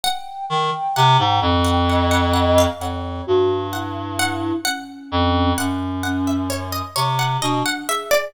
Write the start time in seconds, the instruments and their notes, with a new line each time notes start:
0.03 harpsichord F#5, flute G5
0.50 clarinet D#3, flute G5
0.96 clarinet C3, harpsichord F#5
1.19 clarinet G#2
1.42 clarinet F2
1.64 harpsichord F#5
1.88 flute D#5, harpsichord F#5
2.11 harpsichord F#5
2.33 harpsichord F#5
2.58 harpsichord F5
2.80 clarinet F2, flute C#5, harpsichord F#5
3.27 clarinet G2, flute F#4
3.73 flute E4, harpsichord F#5
4.19 harpsichord F#5
4.65 flute C#4, harpsichord F#5
5.12 clarinet F2
5.57 clarinet F#2, flute C#4, harpsichord F#5
6.03 flute C#4, harpsichord F#5
6.27 harpsichord E5
6.50 harpsichord C#5
6.72 harpsichord D#5
6.96 clarinet C3, harpsichord C#5
7.19 harpsichord F#5
7.42 clarinet B2, flute D4, harpsichord D#5
7.66 harpsichord F#5
7.88 flute G#4, harpsichord E5
8.11 harpsichord D5